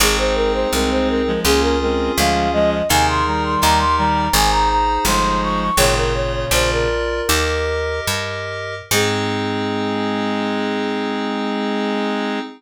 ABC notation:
X:1
M:4/4
L:1/16
Q:1/4=83
K:Ab
V:1 name="Flute"
A c B c B c B2 A B B2 f2 e e | a c' b c' b c' b2 a b b2 c'2 d' d' | "^rit." d B d d c B7 z4 | A16 |]
V:2 name="Clarinet"
[A,C]4 [A,C]3 [F,A,] [B,D]2 [A,C]2 [F,A,]2 [F,A,]2 | [C,E,]2 [E,G,]4 [E,G,]2 z4 [F,A,]4 | "^rit." [B,,D,]6 z10 | A,16 |]
V:3 name="Electric Piano 2"
[CEA]8 [DFA]8 | [EAB]4 [EGB]4 [EAc]8 | "^rit." [FAd]4 [FB=d]4 [GBe]8 | [CEA]16 |]
V:4 name="Electric Bass (finger)" clef=bass
A,,,4 C,,4 D,,4 =D,,4 | E,,4 E,,4 A,,,4 G,,,4 | "^rit." A,,,4 B,,,4 E,,4 G,,4 | A,,16 |]